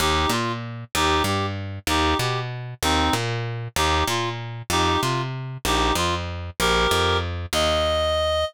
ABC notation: X:1
M:3/4
L:1/8
Q:"Swing" 1/4=191
K:Eb
V:1 name="Clarinet"
[EG]2 F z3 | [EG]2 G z3 | [EG]2 G z3 | [CE]2 z4 |
[EG]2 F z3 | [EG]2 F z3 | [EG]2 F z3 | [GB]4 z2 |
e6 |]
V:2 name="Electric Bass (finger)" clef=bass
E,,2 B,,4 | E,,2 G,,4 | E,,2 _C,4 | E,,2 B,,4 |
E,,2 B,,4 | F,,2 C,4 | B,,,2 F,,4 | B,,,2 F,,4 |
E,,6 |]